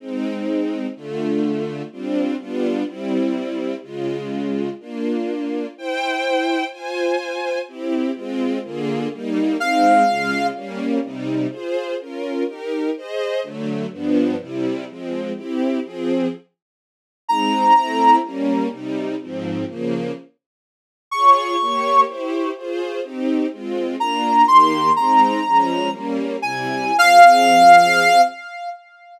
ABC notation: X:1
M:6/8
L:1/8
Q:3/8=125
K:Fm
V:1 name="Clarinet"
z6 | z6 | z6 | z6 |
z6 | z6 | z6 | z6 |
z6 | z6 | f6 | z6 |
z6 | z6 | z6 | z6 |
z6 | z6 | b6 | z6 |
z6 | z6 | d'6 | z6 |
z6 | b3 c'3 | b6 | "^rit." z3 a3 |
f6 |]
V:2 name="String Ensemble 1"
[A,CE]6 | [=D,=A,F]6 | [G,C=DF]3 [G,=B,DF]3 | [G,C=E]6 |
[D,A,F]6 | [B,=DF]6 | [=Ecg]6 | [Fca]6 |
[C=EG]3 [A,CF]3 | [=D,B,FA]3 [G,B,E]3 | [A,CE]3 [D,A,F]3 | [G,B,D]3 [C,G,E]3 |
[FAc]3 [DFB]3 | [EGB]3 [Ace]3 | [=D,^F,=A,]3 [G,,=F,=B,=D]3 | [C,G,=E]3 [F,A,C]3 |
[C=EG]3 [F,CA]3 | z6 | [A,CE]3 [=A,C=E]3 | [G,B,D]3 [C,G,E]3 |
[A,,F,C]3 [D,F,B,]3 | z6 | [FAd]3 [B,Gd]3 | [=EGc]3 [FAc]3 |
[CEG]3 [A,CF]3 | [B,=DF]3 [E,B,G]3 | [A,CE]3 [F,A,D]3 | "^rit." [G,B,D]3 [C,G,=E]3 |
[F,CA]6 |]